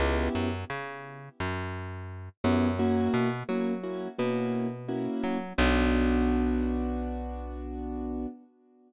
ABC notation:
X:1
M:4/4
L:1/8
Q:1/4=86
K:Bm
V:1 name="Acoustic Grand Piano"
[B,CEG]7 [B,CEG] | [^A,CEF]2 [A,CEF] [A,CEF] [A,CEF]2 [A,CEF]2 | [B,DF]8 |]
V:2 name="Electric Bass (finger)" clef=bass
C,, F,, C,2 F,,3 F,,- | F,, B,, F,2 B,,3 F, | B,,,8 |]